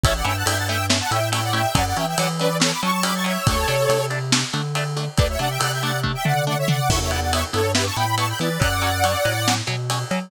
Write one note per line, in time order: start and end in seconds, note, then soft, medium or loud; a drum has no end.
0.04 0.22 A1 medium
0.04 0.13 A3 medium
0.04 0.13 C#4 medium
0.04 0.13 E4 medium
0.04 0.14 C#5 medium
0.04 0.14 E5 medium
0.04 kick loud
0.04 ride loud
0.15 0.25 D5 medium
0.15 0.25 F#5 medium
0.25 0.43 G2 medium
0.25 0.33 A3 medium
0.25 0.33 C#4 medium
0.25 0.33 E4 medium
0.25 0.36 E5 medium
0.25 0.36 G5 medium
0.25 ride medium
0.36 0.46 F#5 medium
0.36 0.46 A5 medium
0.46 1.01 G2 medium
0.46 0.54 A3 medium
0.46 0.54 C#4 medium
0.46 0.54 E4 medium
0.46 0.57 E5 medium
0.46 0.57 G5 medium
0.46 ride loud
0.57 0.67 F#5 medium
0.57 0.67 A5 medium
0.68 0.78 A3 medium
0.68 0.78 C#4 medium
0.68 0.78 E4 medium
0.68 0.86 E5 medium
0.68 0.86 G5 medium
0.68 ride medium
0.90 0.98 A3 medium
0.90 0.98 C#4 medium
0.90 0.98 E4 medium
0.90 snare loud
1.01 1.11 F#5 medium
1.01 1.11 A5 medium
1.11 1.66 A2 medium
1.11 1.20 A3 medium
1.11 1.20 C#4 medium
1.11 1.20 E4 medium
1.11 1.29 E5 medium
1.11 1.29 G5 medium
1.11 ride medium
1.32 1.41 A3 medium
1.32 1.41 C#4 medium
1.32 1.41 E4 medium
1.32 1.43 E5 medium
1.32 1.43 G5 medium
1.32 ride loud
1.43 1.53 D5 medium
1.43 1.53 F#5 medium
1.53 1.62 A3 medium
1.53 1.62 C#4 medium
1.53 1.62 E4 medium
1.53 1.75 E5 medium
1.53 1.75 G5 medium
1.53 ride medium
1.75 1.93 F#2 medium
1.75 1.83 F#3 medium
1.75 1.83 C#4 medium
1.75 1.85 D5 medium
1.75 1.85 F#5 medium
1.75 kick medium
1.75 ride loud
1.87 1.97 D5 medium
1.87 1.97 F#5 medium
1.96 2.15 E3 medium
1.96 2.05 F#3 medium
1.96 2.05 C#4 medium
1.96 2.06 E5 medium
1.96 2.06 G5 medium
1.96 ride medium
2.07 2.18 E5 medium
2.07 2.18 G5 medium
2.18 2.73 E3 medium
2.18 2.28 F#3 medium
2.18 2.28 C#4 medium
2.18 2.28 D5 medium
2.18 2.28 F#5 medium
2.18 ride loud
2.40 2.49 F#3 medium
2.40 2.49 C#4 medium
2.40 2.57 B4 medium
2.40 2.57 D5 medium
2.40 ride medium
2.60 2.69 F#3 medium
2.60 2.69 C#4 medium
2.60 2.72 A4 medium
2.60 2.72 C#5 medium
2.60 snare loud
2.71 2.81 B5 medium
2.71 2.81 D6 medium
2.83 2.91 F#3 medium
2.83 3.37 F#3 medium
2.83 2.91 C#4 medium
2.83 3.04 A5 medium
2.83 3.04 C#6 medium
2.83 ride medium
3.03 3.12 F#3 medium
3.03 3.12 C#4 medium
3.03 3.14 B5 medium
3.03 3.14 D6 medium
3.03 ride loud
3.15 3.25 A5 medium
3.15 3.25 C#6 medium
3.24 3.33 F#3 medium
3.24 3.33 C#4 medium
3.24 3.46 C#5 medium
3.24 3.46 E5 medium
3.24 ride medium
3.47 3.65 D2 medium
3.47 3.57 A3 medium
3.47 3.57 D4 medium
3.47 4.06 A4 medium
3.47 4.06 C#5 medium
3.47 kick loud
3.47 ride loud
3.68 3.87 C3 medium
3.68 3.76 A3 medium
3.68 3.76 D4 medium
3.68 ride medium
3.89 4.44 C3 medium
3.89 3.98 A3 medium
3.89 3.98 D4 medium
3.89 ride loud
4.10 4.19 A3 medium
4.10 4.19 D4 medium
4.10 ride medium
4.32 4.41 A3 medium
4.32 4.41 D4 medium
4.32 snare loud
4.53 5.08 D3 medium
4.53 4.62 A3 medium
4.53 4.62 D4 medium
4.53 ride medium
4.75 4.84 A3 medium
4.75 4.84 D4 medium
4.75 ride medium
4.97 5.05 A3 medium
4.97 5.05 D4 medium
4.97 ride medium
5.18 5.37 D2 medium
5.18 5.27 A3 medium
5.18 5.27 D4 medium
5.18 5.28 B4 medium
5.18 5.28 D5 medium
5.18 kick loud
5.18 ride medium
5.29 5.40 C#5 medium
5.29 5.40 E5 medium
5.39 5.58 C3 medium
5.39 5.48 A3 medium
5.39 5.48 D4 medium
5.39 5.50 D5 medium
5.39 5.50 F#5 medium
5.39 ride medium
5.50 5.60 E5 medium
5.50 5.60 G5 medium
5.60 6.16 C3 medium
5.60 5.69 A3 medium
5.60 5.69 D4 medium
5.60 5.72 D5 medium
5.60 5.72 F#5 medium
5.60 ride loud
5.72 5.82 E5 medium
5.72 5.82 G5 medium
5.82 5.92 A3 medium
5.82 5.92 D4 medium
5.82 6.00 D5 medium
5.82 6.00 F#5 medium
5.82 ride medium
6.03 6.12 A3 medium
6.03 6.12 D4 medium
6.03 kick medium
6.15 6.25 E5 medium
6.15 6.25 G5 medium
6.25 6.80 D3 medium
6.25 6.34 A3 medium
6.25 6.34 D4 medium
6.25 6.45 D5 medium
6.25 6.45 F#5 medium
6.25 floor tom medium
6.47 6.56 A3 medium
6.47 6.56 D4 medium
6.47 6.57 D5 medium
6.47 6.57 F#5 medium
6.58 6.69 C#5 medium
6.58 6.69 E5 medium
6.68 6.77 A3 medium
6.68 6.77 D4 medium
6.68 6.89 D5 medium
6.68 6.89 F#5 medium
6.68 floor tom medium
6.89 7.44 E2 medium
6.89 6.99 B3 medium
6.89 6.99 E4 medium
6.89 7.00 C#5 medium
6.89 7.00 E5 medium
6.89 kick loud
6.89 crash loud
7.01 7.11 C#5 medium
7.01 7.11 E5 medium
7.10 7.20 B3 medium
7.10 7.20 E4 medium
7.10 7.20 D5 medium
7.10 7.20 F#5 medium
7.10 ride medium
7.21 7.32 D5 medium
7.21 7.32 F#5 medium
7.33 7.41 B3 medium
7.33 7.41 E4 medium
7.33 7.44 C#5 medium
7.33 7.44 E5 medium
7.33 ride loud
7.53 7.90 G2 medium
7.53 7.62 B3 medium
7.53 7.62 E4 medium
7.53 7.72 A4 medium
7.53 7.72 C#5 medium
7.53 ride medium
7.75 7.84 B3 medium
7.75 7.84 E4 medium
7.75 7.86 G4 medium
7.75 7.86 B4 medium
7.75 snare loud
7.86 7.96 A5 medium
7.86 7.96 C#6 medium
7.96 8.33 A2 medium
7.96 8.06 B3 medium
7.96 8.06 E4 medium
7.96 8.15 G5 medium
7.96 8.15 B5 medium
7.96 ride medium
8.18 8.26 B3 medium
8.18 8.26 E4 medium
8.18 8.28 A5 medium
8.18 8.28 C#6 medium
8.18 ride medium
8.28 8.39 G5 medium
8.28 8.39 B5 medium
8.39 8.58 E3 medium
8.39 8.49 B3 medium
8.39 8.49 E4 medium
8.39 8.61 B4 medium
8.39 8.59 D5 medium
8.39 ride medium
8.60 9.16 F#2 medium
8.60 8.68 F#3 medium
8.60 8.68 C#4 medium
8.60 9.54 D5 medium
8.60 9.54 F#5 medium
8.60 kick medium
8.60 ride medium
8.82 8.90 F#3 medium
8.82 8.90 C#4 medium
8.82 ride medium
9.04 9.13 F#3 medium
9.04 9.13 C#4 medium
9.04 ride medium
9.25 9.62 A2 medium
9.25 9.33 F#3 medium
9.25 9.33 C#4 medium
9.25 ride medium
9.48 9.57 F#3 medium
9.48 9.57 C#4 medium
9.48 snare loud
9.67 10.04 B2 medium
9.67 9.76 F#3 medium
9.67 9.76 C#4 medium
9.67 ride medium
9.90 9.99 F#3 medium
9.90 9.99 C#4 medium
9.90 ride medium
10.11 10.19 F#3 medium
10.11 10.29 F#3 medium
10.11 10.19 C#4 medium
10.11 ride medium